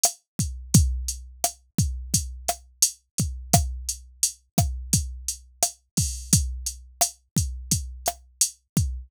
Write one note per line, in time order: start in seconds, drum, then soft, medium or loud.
0.03 cross-stick medium
0.03 closed hi-hat loud
0.39 kick medium
0.39 closed hi-hat medium
0.74 kick medium
0.74 closed hi-hat medium
1.08 closed hi-hat medium
1.44 cross-stick medium
1.44 closed hi-hat medium
1.78 kick medium
1.78 closed hi-hat medium
2.14 kick medium
2.14 closed hi-hat medium
2.48 cross-stick medium
2.48 closed hi-hat medium
2.82 closed hi-hat loud
3.18 kick medium
3.18 closed hi-hat medium
3.53 kick medium
3.53 cross-stick medium
3.53 closed hi-hat medium
3.89 closed hi-hat medium
4.23 closed hi-hat medium
4.58 kick medium
4.58 cross-stick medium
4.58 closed hi-hat medium
4.93 kick medium
4.93 closed hi-hat medium
5.28 closed hi-hat medium
5.62 cross-stick medium
5.62 closed hi-hat medium
5.97 kick medium
5.97 open hi-hat medium
6.33 kick medium
6.33 closed hi-hat medium
6.66 closed hi-hat medium
7.01 cross-stick medium
7.01 closed hi-hat medium
7.36 kick medium
7.36 closed hi-hat medium
7.71 kick medium
7.71 closed hi-hat medium
8.06 cross-stick medium
8.06 closed hi-hat medium
8.41 closed hi-hat medium
8.77 kick medium
8.77 closed hi-hat medium